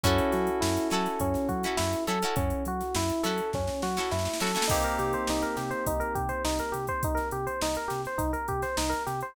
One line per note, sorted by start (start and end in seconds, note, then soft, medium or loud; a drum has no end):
0.04 0.20 F#2 loud
0.04 4.60 C#4 medium
0.04 0.50 C#4 medium
0.04 0.32 C#4 medium
0.04 4.60 E4 medium
0.04 0.50 E4 medium
0.04 4.60 F#4 medium
0.04 0.50 F#4 medium
0.04 4.60 A4 medium
0.04 0.50 A4 medium
0.04 kick loud
0.04 closed hi-hat loud
0.18 closed hi-hat medium
0.32 0.50 F#3 loud
0.32 0.59 F#4 medium
0.32 snare soft
0.32 closed hi-hat medium
0.47 closed hi-hat medium
0.61 0.78 F#2 loud
0.61 0.88 E4 medium
0.61 snare loud
0.77 closed hi-hat medium
0.90 1.08 F#3 loud
0.90 1.38 C#4 medium
0.90 1.38 E4 medium
0.90 1.38 F#4 medium
0.90 1.19 A4 medium
0.90 snare medium
0.90 closed hi-hat medium
0.94 1.38 A4 medium
1.05 snare soft
1.05 closed hi-hat medium
1.20 1.37 F#2 loud
1.20 1.48 C#4 medium
1.20 kick medium
1.20 closed hi-hat loud
1.34 snare soft
1.34 closed hi-hat medium
1.49 1.66 F#3 loud
1.49 1.75 F#4 medium
1.49 kick medium
1.49 closed hi-hat medium
1.63 1.99 C#4 medium
1.63 1.99 E4 medium
1.63 1.99 F#4 medium
1.63 closed hi-hat medium
1.67 1.99 A4 medium
1.77 1.95 F#2 loud
1.77 2.04 E4 medium
1.77 snare loud
1.93 closed hi-hat medium
2.07 2.24 F#3 loud
2.07 2.19 C#4 medium
2.07 2.19 E4 medium
2.07 2.19 F#4 medium
2.07 2.34 A4 medium
2.07 2.19 A4 medium
2.07 closed hi-hat medium
2.22 2.69 C#4 medium
2.22 2.69 E4 medium
2.22 2.69 F#4 medium
2.22 2.69 A4 medium
2.22 closed hi-hat medium
2.36 2.53 F#2 loud
2.36 2.63 C#4 medium
2.36 kick loud
2.36 closed hi-hat loud
2.50 closed hi-hat medium
2.65 2.82 F#3 medium
2.65 2.94 F#4 medium
2.65 closed hi-hat medium
2.80 snare soft
2.80 closed hi-hat medium
2.95 3.12 F#2 loud
2.95 3.23 E4 medium
2.95 snare loud
3.09 closed hi-hat medium
3.23 3.41 F#3 loud
3.23 3.70 C#4 medium
3.23 3.70 E4 medium
3.23 3.70 F#4 medium
3.23 3.50 A4 medium
3.23 3.70 A4 medium
3.23 snare medium
3.23 closed hi-hat medium
3.38 closed hi-hat medium
3.53 3.70 F#2 medium
3.53 3.81 C#4 medium
3.53 kick medium
3.53 snare medium
3.67 snare medium
3.82 3.99 F#3 loud
3.82 4.10 F#4 medium
3.82 snare medium
3.97 4.32 C#4 medium
3.97 4.32 E4 medium
3.97 4.32 F#4 medium
3.97 4.32 A4 medium
3.97 snare medium
4.11 4.28 F#2 loud
4.11 4.38 E4 medium
4.11 snare medium
4.19 snare medium
4.25 snare medium
4.33 snare medium
4.40 4.57 F#3 loud
4.40 4.52 C#4 medium
4.40 4.52 E4 medium
4.40 4.52 F#4 medium
4.40 4.68 A4 medium
4.40 4.52 A4 medium
4.40 snare medium
4.47 snare medium
4.55 4.66 C#4 medium
4.55 4.66 E4 medium
4.55 4.66 F#4 medium
4.55 4.66 A4 medium
4.55 snare medium
4.62 snare loud
4.68 4.86 C2 medium
4.68 9.27 A#3 medium
4.68 9.27 C4 medium
4.68 4.81 D#4 medium
4.68 9.27 D#4 medium
4.68 9.27 G4 medium
4.68 kick loud
4.68 crash loud
4.83 4.97 A#4 medium
4.83 closed hi-hat medium
4.98 5.15 C3 medium
4.98 5.12 G4 medium
4.98 snare soft
4.98 closed hi-hat medium
5.13 5.27 C5 medium
5.13 closed hi-hat medium
5.27 5.45 C2 medium
5.27 5.43 D#4 medium
5.27 snare loud
5.42 5.56 A#4 medium
5.42 snare soft
5.42 closed hi-hat medium
5.57 5.74 C3 medium
5.57 5.70 G4 medium
5.57 snare medium
5.57 closed hi-hat medium
5.71 5.84 C5 medium
5.71 closed hi-hat medium
5.86 6.03 C2 medium
5.86 6.00 D#4 medium
5.86 kick medium
5.86 closed hi-hat loud
6.00 6.13 A#4 medium
6.00 closed hi-hat medium
6.15 6.32 C3 medium
6.15 6.29 G4 medium
6.15 kick medium
6.15 closed hi-hat medium
6.29 6.42 C5 medium
6.29 closed hi-hat medium
6.45 6.61 C2 medium
6.45 6.58 D#4 medium
6.45 snare loud
6.59 6.73 A#4 medium
6.59 closed hi-hat medium
6.72 6.90 C3 medium
6.72 6.86 G4 medium
6.72 closed hi-hat medium
6.87 7.02 C5 medium
6.87 kick medium
6.87 closed hi-hat medium
7.03 7.19 C2 medium
7.03 7.18 D#4 medium
7.03 kick loud
7.03 closed hi-hat loud
7.15 7.28 A#4 medium
7.15 snare soft
7.15 closed hi-hat medium
7.31 7.48 C3 medium
7.31 7.46 G4 medium
7.31 closed hi-hat medium
7.47 7.60 C5 medium
7.47 closed hi-hat medium
7.61 7.78 C2 medium
7.61 7.76 D#4 medium
7.61 snare loud
7.75 7.90 A#4 medium
7.75 closed hi-hat medium
7.88 8.07 C3 medium
7.88 8.01 G4 medium
7.88 snare medium
7.88 closed hi-hat medium
8.04 8.20 C5 medium
8.04 snare soft
8.04 closed hi-hat medium
8.18 8.36 C2 medium
8.18 8.31 D#4 medium
8.18 kick medium
8.18 closed hi-hat loud
8.33 8.46 A#4 medium
8.33 closed hi-hat medium
8.48 8.65 C3 medium
8.48 8.62 G4 medium
8.48 kick medium
8.48 closed hi-hat medium
8.62 8.76 C5 medium
8.62 snare soft
8.62 closed hi-hat medium
8.77 8.94 C2 medium
8.77 8.91 D#4 medium
8.77 snare loud
8.90 9.03 A#4 medium
8.90 closed hi-hat medium
9.07 9.23 C3 medium
9.07 9.20 G4 medium
9.07 snare soft
9.07 closed hi-hat medium
9.21 9.35 C5 medium
9.21 closed hi-hat medium